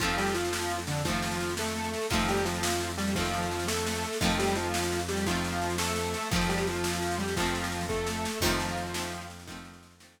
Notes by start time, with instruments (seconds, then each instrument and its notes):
0.00 synth bass 1 F2, acoustic guitar (steel) D#3 F3 A3, lead 1 (square) F3 F4, kick, snare
0.04 acoustic guitar (steel) C4
0.09 snare
0.17 lead 1 (square) G3 G4, snare
0.26 snare
0.34 lead 1 (square) F3 F4, snare
0.45 snare
0.53 snare
0.61 snare
0.70 snare
0.79 snare
0.87 lead 1 (square) D3 D4, snare
0.96 snare
1.05 acoustic guitar (steel) D#3 F3 A3, lead 1 (square) F3 F4, kick, snare
1.10 acoustic guitar (steel) C4
1.14 snare
1.22 snare
1.31 snare
1.40 snare
1.49 snare
1.57 lead 1 (square) A3 A4, snare
1.67 snare
1.76 snare
1.84 snare
1.94 snare
2.02 snare
2.10 synth bass 1 F2, acoustic guitar (steel) D#3 F3 A3, lead 1 (square) F3 F4, kick, snare
2.15 acoustic guitar (steel) C4
2.19 snare
2.28 lead 1 (square) G3 G4, snare
2.36 snare
2.45 lead 1 (square) F3 F4, snare
2.54 snare
2.63 snare
2.72 snare
2.80 snare
2.90 snare
2.98 lead 1 (square) G3 G4, snare
3.07 snare
3.15 acoustic guitar (steel) D#3 F3 A3, lead 1 (square) F3 F4, kick, snare
3.20 acoustic guitar (steel) C4
3.25 snare
3.33 snare
3.42 snare
3.51 snare
3.59 snare
3.67 lead 1 (square) A3 A4, snare
3.77 snare
3.86 snare
3.95 snare
4.03 snare
4.13 snare
4.21 synth bass 1 F2, acoustic guitar (steel) D#3 F3 A3, lead 1 (square) F3 F4, kick, snare
4.25 acoustic guitar (steel) C4
4.30 snare
4.39 lead 1 (square) G3 G4, snare
4.47 snare
4.55 lead 1 (square) F3 F4, snare
4.65 snare
4.74 snare
4.83 snare
4.92 snare
4.99 snare
5.09 lead 1 (square) G3 G4, snare
5.17 snare
5.26 acoustic guitar (steel) D#3 F3 A3, lead 1 (square) F3 F4, kick, snare
5.31 acoustic guitar (steel) C4
5.35 snare
5.44 snare
5.53 snare
5.62 snare
5.70 snare
5.78 lead 1 (square) A3 A4, snare
5.87 snare
5.96 snare
6.05 snare
6.14 snare
6.23 snare
6.31 synth bass 1 F2, acoustic guitar (steel) D#3 F3 A3, lead 1 (square) F3 F4, kick, snare
6.36 acoustic guitar (steel) C4
6.41 snare
6.49 lead 1 (square) G3 G4, snare
6.58 snare
6.67 lead 1 (square) F3 F4, snare
6.75 snare
6.84 snare
6.93 snare
7.02 snare
7.11 snare
7.18 lead 1 (square) G3 G4, snare
7.28 snare
7.36 acoustic guitar (steel) D#3 F3 A3, lead 1 (square) F3 F4, kick, snare
7.42 acoustic guitar (steel) C4, snare
7.55 snare
7.64 snare
7.72 snare
7.81 snare
7.89 lead 1 (square) A3 A4, kick, snare
8.07 snare
8.25 snare
8.40 synth bass 1 F2, acoustic guitar (steel) D#3 F3, lead 1 (square) F3 F4, kick, snare, crash
8.45 acoustic guitar (steel) A3 C4
8.51 snare
8.60 snare
8.68 snare
8.77 snare
8.86 snare
8.94 acoustic guitar (steel) D#3 F3 A3, snare
8.99 acoustic guitar (steel) C4
9.03 snare
9.12 snare
9.21 snare
9.30 snare
9.40 snare
9.47 acoustic guitar (steel) D#3 F3 A3, kick, snare
9.52 acoustic guitar (steel) C4
9.56 snare
9.65 snare
9.74 snare
9.83 snare
9.91 snare
10.00 acoustic guitar (steel) D#3 F3 A3, snare
10.04 acoustic guitar (steel) C4, snare
10.18 snare